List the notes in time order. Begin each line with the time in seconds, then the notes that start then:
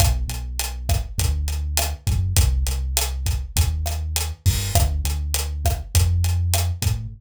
0.00 B1, kick, cross-stick, closed hi-hat
0.28 B1, closed hi-hat
0.59 closed hi-hat
0.89 kick, cross-stick, closed hi-hat
1.18 D2, kick, closed hi-hat
1.48 closed hi-hat
1.77 cross-stick, closed hi-hat
2.07 F#2, kick, closed hi-hat
2.37 C2, kick, closed hi-hat
2.67 C2, closed hi-hat
2.97 cross-stick, closed hi-hat
3.26 kick, closed hi-hat
3.56 D#2, kick, closed hi-hat
3.86 cross-stick, closed hi-hat
4.16 closed hi-hat
4.46 G2, kick, open hi-hat
4.75 D2, kick, cross-stick, closed hi-hat
5.04 D2, closed hi-hat
5.34 closed hi-hat
5.65 kick, cross-stick, closed hi-hat
5.95 F2, kick, closed hi-hat
6.24 closed hi-hat
6.54 cross-stick, closed hi-hat
6.82 A2, kick, closed hi-hat